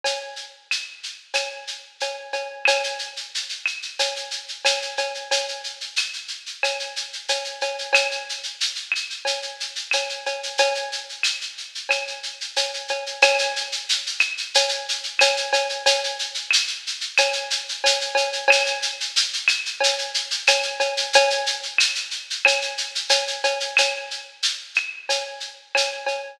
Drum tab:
SH |x-x-x-x-x-x-x-x-|xxxxxxxxxxxxxxxx|xxxxxxxxxxxxxxxx|xxxxxxxxxxxxxxxx|
CB |x-------x---x-x-|x-------x---x-x-|x-------x---x-x-|x-------x---x-x-|
CL |----x---x-------|x-----x-----x---|----x---x-------|x-----x-----x---|

SH |xxxxxxxxxxxxxxxx|xxxxxxxxxxxxxxxx|xxxxxxxxxxxxxxxx|xxxxxxxxxxxxxxxx|
CB |x-------x---x-x-|x-------x---x-x-|x-------x---x-x-|x-------x---x-x-|
CL |----x---x-------|x-----x-----x---|----x---x-------|x-----x-----x---|

SH |xxxxxxxxxxxxxxxx|x-x-x-x-x-x-x-x-|
CB |x-------x---x-x-|x-------x---x-x-|
CL |----x---x-------|x-----x-----x---|